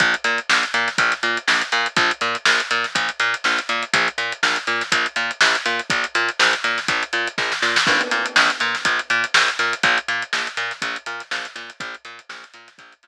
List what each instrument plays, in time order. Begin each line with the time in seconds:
0.00 electric bass (finger) A#1, kick, closed hi-hat
0.14 closed hi-hat
0.24 electric bass (finger) A#2, closed hi-hat
0.38 closed hi-hat
0.49 electric bass (finger) A#1, snare
0.63 closed hi-hat
0.74 electric bass (finger) A#2, closed hi-hat
0.88 snare, closed hi-hat
0.98 electric bass (finger) A#1, kick, closed hi-hat
1.12 snare, closed hi-hat
1.23 electric bass (finger) A#2, closed hi-hat
1.37 closed hi-hat
1.48 electric bass (finger) A#1, snare
1.61 closed hi-hat
1.72 electric bass (finger) A#2, closed hi-hat
1.86 closed hi-hat
1.96 electric bass (finger) A#1, kick, closed hi-hat
2.11 closed hi-hat
2.21 electric bass (finger) A#2, closed hi-hat
2.35 closed hi-hat
2.45 electric bass (finger) A#1, snare
2.60 closed hi-hat
2.71 electric bass (finger) A#2, closed hi-hat
2.84 snare, closed hi-hat
2.95 electric bass (finger) A#1, kick, closed hi-hat
3.09 closed hi-hat
3.20 electric bass (finger) A#2, snare, closed hi-hat
3.34 closed hi-hat
3.44 electric bass (finger) A#1, snare
3.59 closed hi-hat
3.69 electric bass (finger) A#2, closed hi-hat
3.83 closed hi-hat
3.93 electric bass (finger) A#1, kick, closed hi-hat
4.08 closed hi-hat
4.18 electric bass (finger) A#2, closed hi-hat
4.32 closed hi-hat
4.43 electric bass (finger) A#1, snare
4.56 closed hi-hat
4.67 electric bass (finger) A#2, closed hi-hat
4.81 snare, closed hi-hat
4.92 electric bass (finger) A#1, kick, closed hi-hat
5.06 closed hi-hat
5.16 electric bass (finger) A#2, closed hi-hat
5.31 closed hi-hat
5.41 electric bass (finger) A#1, snare
5.55 closed hi-hat
5.66 electric bass (finger) A#2, closed hi-hat
5.79 closed hi-hat
5.90 electric bass (finger) A#1, kick, closed hi-hat
6.04 closed hi-hat
6.15 electric bass (finger) A#2, snare, closed hi-hat
6.29 closed hi-hat
6.39 electric bass (finger) A#1, snare
6.53 closed hi-hat
6.64 electric bass (finger) A#2, snare, closed hi-hat
6.78 snare, closed hi-hat
6.88 electric bass (finger) A#1, kick, closed hi-hat
7.03 closed hi-hat
7.13 electric bass (finger) A#2, closed hi-hat
7.27 closed hi-hat
7.38 electric bass (finger) A#1, kick, snare
7.52 snare
7.62 electric bass (finger) A#2, snare
7.76 snare
7.87 electric bass (finger) A#1, kick, crash
8.01 closed hi-hat
8.11 electric bass (finger) A#2, snare, closed hi-hat
8.26 closed hi-hat
8.36 electric bass (finger) A#1, snare
8.50 closed hi-hat
8.60 electric bass (finger) A#2, closed hi-hat
8.75 snare, closed hi-hat
8.85 electric bass (finger) A#1, kick, closed hi-hat
8.99 closed hi-hat
9.10 electric bass (finger) A#2, closed hi-hat
9.24 closed hi-hat
9.34 electric bass (finger) A#1, snare
9.48 closed hi-hat
9.59 electric bass (finger) A#2, snare, closed hi-hat
9.73 closed hi-hat
9.83 electric bass (finger) A#1, kick, closed hi-hat
9.98 closed hi-hat
10.08 electric bass (finger) A#2, closed hi-hat
10.22 closed hi-hat
10.33 electric bass (finger) A#1, snare
10.47 closed hi-hat
10.57 electric bass (finger) A#2, snare, closed hi-hat
10.71 snare, closed hi-hat
10.82 electric bass (finger) A#1, kick, closed hi-hat
10.96 closed hi-hat
11.06 electric bass (finger) A#2, closed hi-hat
11.20 snare, closed hi-hat
11.31 electric bass (finger) A#1, snare
11.45 snare, closed hi-hat
11.56 electric bass (finger) A#2, snare, closed hi-hat
11.70 closed hi-hat
11.80 electric bass (finger) A#1, kick, closed hi-hat
11.94 closed hi-hat
12.05 electric bass (finger) A#2, closed hi-hat
12.19 closed hi-hat
12.29 electric bass (finger) A#1, snare
12.44 closed hi-hat
12.54 electric bass (finger) A#2, closed hi-hat
12.68 snare, closed hi-hat
12.78 electric bass (finger) A#1, kick, closed hi-hat
12.92 closed hi-hat
13.03 electric bass (finger) A#2, closed hi-hat